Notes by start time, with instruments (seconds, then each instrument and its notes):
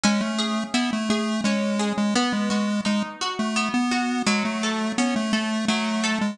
0.04 lead 1 (square) G#3, acoustic guitar (steel) C#4
0.21 lead 1 (square) A3
0.39 acoustic guitar (steel) G#4
0.74 lead 1 (square) B3, acoustic guitar (steel) E4
0.93 lead 1 (square) A3
1.10 lead 1 (square) A3, acoustic guitar (steel) G#4
1.44 lead 1 (square) G#3, acoustic guitar (steel) C#4
1.79 acoustic guitar (steel) G#4
1.98 lead 1 (square) G#3
2.15 acoustic guitar (steel) B3, lead 1 (square) B3
2.33 lead 1 (square) G#3
2.50 lead 1 (square) G#3, acoustic guitar (steel) F#4
2.85 lead 1 (square) G#3, acoustic guitar (steel) D#4
3.21 acoustic guitar (steel) F#4
3.39 lead 1 (square) A3
3.56 acoustic guitar (steel) B3
3.74 lead 1 (square) B3
3.91 acoustic guitar (steel) F#4
4.26 acoustic guitar (steel) F#3, lead 1 (square) G#3
4.45 lead 1 (square) A3
4.63 acoustic guitar (steel) A4
4.98 lead 1 (square) B3, acoustic guitar (steel) C#4
5.16 lead 1 (square) A3
5.33 lead 1 (square) A3, acoustic guitar (steel) A4
5.68 acoustic guitar (steel) F#3, lead 1 (square) A3
6.04 acoustic guitar (steel) A4
6.21 lead 1 (square) G#3